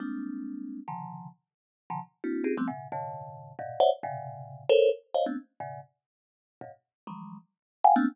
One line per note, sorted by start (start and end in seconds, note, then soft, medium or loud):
0.00 0.80 G3 medium
0.00 0.80 G#3 medium
0.00 0.80 A#3 medium
0.00 0.80 C4 medium
0.00 0.80 D4 medium
0.88 1.28 B2 medium
0.88 1.28 C#3 medium
0.88 1.28 D3 medium
0.88 1.28 D#3 medium
0.88 1.28 F3 medium
1.90 2.00 B2 medium
1.90 2.00 C#3 medium
1.90 2.00 D3 medium
1.90 2.00 D#3 medium
1.90 2.00 F3 medium
2.24 2.44 A#3 medium
2.24 2.44 C4 medium
2.24 2.44 D4 medium
2.24 2.44 E4 medium
2.24 2.44 F#4 medium
2.44 2.54 C4 medium
2.44 2.54 C#4 medium
2.44 2.54 D#4 medium
2.44 2.54 F4 medium
2.44 2.54 G4 medium
2.44 2.54 G#4 medium
2.57 2.67 F3 medium
2.57 2.67 G3 medium
2.57 2.67 A3 medium
2.57 2.67 B3 medium
2.57 2.67 C4 medium
2.68 2.88 A2 medium
2.68 2.88 B2 medium
2.68 2.88 C#3 medium
2.92 3.52 F#2 medium
2.92 3.52 G#2 medium
2.92 3.52 A#2 medium
2.92 3.52 C3 medium
2.92 3.52 D3 medium
3.59 3.79 G2 loud
3.59 3.79 G#2 loud
3.59 3.79 A#2 loud
3.59 3.79 B2 loud
3.80 3.90 C5 loud
3.80 3.90 C#5 loud
3.80 3.90 D5 loud
3.80 3.90 E5 loud
3.80 3.90 F#5 loud
4.03 4.64 G2 loud
4.03 4.64 A2 loud
4.03 4.64 A#2 loud
4.03 4.64 B2 loud
4.03 4.64 C3 loud
4.03 4.64 C#3 loud
4.69 4.90 A4 loud
4.69 4.90 A#4 loud
4.69 4.90 C5 loud
4.69 4.90 C#5 loud
5.14 5.25 C5 medium
5.14 5.25 C#5 medium
5.14 5.25 D#5 medium
5.14 5.25 F5 medium
5.26 5.36 A3 medium
5.26 5.36 B3 medium
5.26 5.36 C4 medium
5.26 5.36 C#4 medium
5.26 5.36 D4 medium
5.60 5.80 G2 medium
5.60 5.80 A2 medium
5.60 5.80 B2 medium
5.60 5.80 C#3 medium
6.61 6.71 F#2 medium
6.61 6.71 G#2 medium
6.61 6.71 A#2 medium
6.61 6.71 B2 medium
7.07 7.37 D#3 soft
7.07 7.37 E3 soft
7.07 7.37 F3 soft
7.07 7.37 F#3 soft
7.07 7.37 G3 soft
7.07 7.37 G#3 soft
7.84 7.94 F5 loud
7.84 7.94 F#5 loud
7.84 7.94 G5 loud
7.84 7.94 G#5 loud
7.96 8.06 A3 loud
7.96 8.06 A#3 loud
7.96 8.06 B3 loud
7.96 8.06 C4 loud
7.96 8.06 D4 loud